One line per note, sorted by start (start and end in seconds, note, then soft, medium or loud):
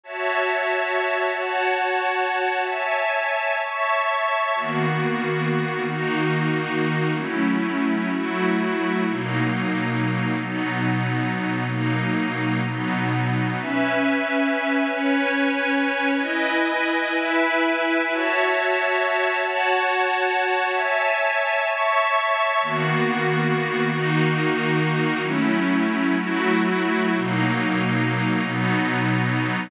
0.03 1.31 F#4 medium
0.03 1.31 C#5 medium
0.03 1.31 E5 medium
0.03 1.31 A5 medium
1.33 2.60 F#4 medium
1.33 2.60 C#5 medium
1.33 2.60 F#5 medium
1.33 2.60 A5 medium
2.61 3.57 C#5 medium
2.61 3.57 E5 medium
2.61 3.57 G#5 medium
2.61 3.57 A5 medium
3.59 4.55 C#5 medium
3.59 4.55 E5 medium
3.59 4.55 A5 medium
3.59 4.55 C#6 medium
4.55 5.83 D#3 medium
4.55 5.83 A#3 medium
4.55 5.83 B3 medium
4.55 5.83 F#4 medium
5.85 7.13 D#3 medium
5.85 7.13 A#3 medium
5.85 7.13 D#4 medium
5.85 7.13 F#4 medium
7.13 8.09 F#3 medium
7.13 8.09 A3 medium
7.13 8.09 C#4 medium
7.13 8.09 E4 medium
8.09 9.05 F#3 medium
8.09 9.05 A3 medium
8.09 9.05 E4 medium
8.09 9.05 F#4 medium
9.07 10.35 B2 medium
9.07 10.35 F#3 medium
9.07 10.35 A#3 medium
9.07 10.35 D#4 medium
10.35 11.63 B2 medium
10.35 11.63 F#3 medium
10.35 11.63 B3 medium
10.35 11.63 D#4 medium
11.64 12.59 B2 medium
11.64 12.59 F#3 medium
11.64 12.59 A#3 medium
11.64 12.59 D#4 medium
12.61 13.57 B2 medium
12.61 13.57 F#3 medium
12.61 13.57 B3 medium
12.61 13.57 D#4 medium
13.58 14.86 C#4 medium
13.58 14.86 B4 medium
13.58 14.86 E5 medium
13.58 14.86 G#5 medium
14.88 16.16 C#4 medium
14.88 16.15 B4 medium
14.88 16.16 C#5 medium
14.88 16.15 G#5 medium
16.16 17.11 E4 medium
16.16 17.11 B4 medium
16.16 17.11 D#5 medium
16.16 17.11 G#5 medium
17.14 18.09 E4 loud
17.14 18.09 B4 loud
17.14 18.09 E5 loud
17.14 18.09 G#5 medium
18.10 19.37 F#4 medium
18.10 19.37 C#5 loud
18.10 19.37 E5 medium
18.10 19.37 A5 medium
19.40 20.67 F#4 medium
19.40 20.67 C#5 loud
19.40 20.67 F#5 medium
19.40 20.67 A5 loud
20.69 21.65 C#5 loud
20.69 21.65 E5 loud
20.69 21.65 G#5 medium
20.69 21.65 A5 medium
21.65 22.61 C#5 medium
21.65 22.61 E5 loud
21.65 22.61 A5 medium
21.65 22.61 C#6 loud
22.62 23.89 D#3 medium
22.62 23.89 A#3 medium
22.62 23.89 B3 medium
22.62 23.89 F#4 loud
23.90 25.18 D#3 medium
23.90 25.18 A#3 medium
23.90 25.18 D#4 loud
23.90 25.18 F#4 loud
25.20 26.16 F#3 medium
25.20 26.16 A3 medium
25.20 26.16 C#4 medium
25.20 26.16 E4 medium
26.17 27.12 F#3 loud
26.17 27.12 A3 medium
26.17 27.12 E4 medium
26.17 27.12 F#4 medium
27.14 28.42 B2 medium
27.14 28.42 F#3 loud
27.14 28.42 A#3 medium
27.14 28.42 D#4 medium
28.42 29.70 B2 medium
28.42 29.70 F#3 medium
28.42 29.70 B3 medium
28.42 29.70 D#4 medium